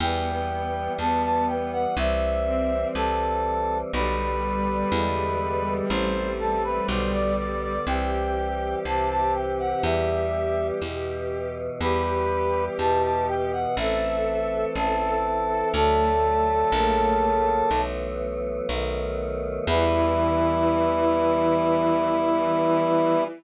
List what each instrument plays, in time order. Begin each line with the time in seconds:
0.00 electric bass (finger) E2, choir aahs E3 G3 B3, violin B3, brass section G5
0.99 electric bass (finger) E2, violin B3, brass section A5
1.23 brass section A5
1.48 brass section G5
1.72 brass section F#5
1.97 electric bass (finger) C2, choir aahs E3 G3 C4, brass section E5
2.46 violin C4
2.95 electric bass (finger) C2, brass section A4
3.93 electric bass (finger) B1, choir aahs D3 G3 B3, violin G3, brass section B4
4.92 electric bass (finger) E2, choir aahs D3 E3 G#3 B3
5.90 electric bass (finger) A1, choir aahs E3 A3 C4, brass section C5
6.39 brass section A4
6.64 brass section B4
6.89 electric bass (finger) B1, choir aahs D3 G3 B3, brass section C5
7.13 brass section D5
7.38 brass section D5
7.62 brass section D5
7.87 electric bass (finger) C2, choir aahs E3 G3 C4, violin G4, brass section G5
8.85 electric bass (finger) C2, choir aahs C3 E3 C4, brass section A5
9.10 brass section A5
9.34 brass section G5
9.59 brass section F#5
9.83 electric bass (finger) E2, choir aahs E3 G3 B3, brass section E5
10.82 electric bass (finger) E2, choir aahs B2 E3 B3
11.80 electric bass (finger) E2, choir aahs E3 G3 B3, violin G4, brass section B4
12.78 electric bass (finger) E2, choir aahs B2 E3 B3, brass section A5
13.03 brass section A5
13.28 brass section G5
13.52 brass section F#5
13.77 electric bass (finger) A1, choir aahs E3 A3 C4, violin A4, brass section E5
14.75 electric bass (finger) A1, choir aahs E3 C4 E4, brass section A4
15.49 violin A4
15.74 electric bass (finger) D2, choir aahs D3 F#3 A3, violin A3, brass section A4
16.72 electric bass (finger) A#1, choir aahs C#3 F#3 A#3
17.70 electric bass (finger) B1, choir aahs E3 F#3 A3 B3
18.69 electric bass (finger) B1, choir aahs D#3 F#3 A3 B3
19.67 electric bass (finger) E2, choir aahs E3 G3 B3, violin E3, brass section E4